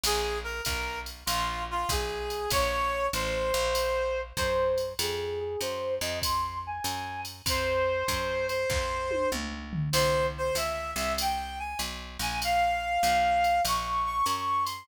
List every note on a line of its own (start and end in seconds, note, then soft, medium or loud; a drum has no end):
0.03 0.61 A#1 medium
0.03 0.38 G#4 medium
0.03 crash loud
0.03 ride loud
0.44 0.62 A#4 medium
0.65 1.23 B1 medium
0.65 0.99 A#4 medium
0.65 kick medium
0.65 hi-hat pedal medium
0.65 ride loud
1.06 ride medium
1.26 1.85 A#1 medium
1.26 1.63 F4 medium
1.26 ride loud
1.71 1.90 F4 medium
1.89 2.47 B1 medium
1.89 2.49 G#4 medium
1.89 kick medium
1.89 hi-hat pedal loud
1.89 ride loud
2.30 ride medium
2.50 3.09 A#1 medium
2.50 3.06 C#5 medium
2.50 kick medium
2.50 ride loud
3.13 3.52 A1 medium
3.13 4.20 C5 medium
3.13 hi-hat pedal medium
3.13 ride medium
3.54 4.33 A#1 medium
3.54 ride medium
3.75 ride loud
4.37 4.94 F#2 medium
4.37 4.93 C5 medium
4.37 kick medium
4.37 hi-hat pedal medium
4.37 ride medium
4.78 ride medium
4.99 5.56 F2 medium
4.99 5.39 G#4 medium
4.99 ride loud
5.39 5.60 G#4 medium
5.60 5.99 F#2 medium
5.60 5.94 C5 medium
5.60 hi-hat pedal medium
5.60 ride medium
6.01 6.80 F2 medium
6.01 6.19 D#5 medium
6.01 ride medium
6.22 6.59 C6 medium
6.22 kick medium
6.22 ride loud
6.66 7.21 G#5 medium
6.84 7.42 F#2 medium
6.84 hi-hat pedal medium
6.84 ride medium
7.25 ride medium
7.46 8.03 F2 medium
7.46 8.46 C5 medium
7.46 kick medium
7.46 ride loud
8.08 8.66 F#2 medium
8.08 kick medium
8.08 hi-hat pedal medium
8.08 ride medium
8.48 9.29 C5 medium
8.48 ride medium
8.70 9.27 F2 medium
8.70 kick medium
8.70 snare medium
9.11 high tom medium
9.32 9.89 C#2 medium
9.32 mid tom medium
9.73 floor tom loud
9.93 10.51 C2 medium
9.93 10.26 C5 medium
9.93 crash loud
9.93 ride loud
10.38 10.56 C5 medium
10.55 10.94 C#2 medium
10.55 10.91 E5 medium
10.55 hi-hat pedal medium
10.55 ride loud
10.96 11.75 C2 medium
10.96 11.13 E5 medium
10.96 ride medium
11.18 11.59 G5 medium
11.18 ride loud
11.59 11.80 G#5 medium
11.79 12.18 B1 medium
11.79 hi-hat pedal medium
11.79 ride medium
12.19 12.98 A#1 medium
12.19 12.39 G#5 medium
12.19 ride medium
12.42 13.61 F5 medium
12.42 ride loud
13.03 13.60 B1 medium
13.03 hi-hat pedal medium
13.03 ride medium
13.44 ride medium
13.65 14.22 A#1 medium
13.65 14.05 C#6 medium
13.65 ride loud
14.05 14.24 C#6 medium
14.26 14.84 F#2 medium
14.26 14.64 C#6 medium
14.26 hi-hat pedal medium
14.26 ride medium
14.64 14.84 C6 medium
14.64 ride medium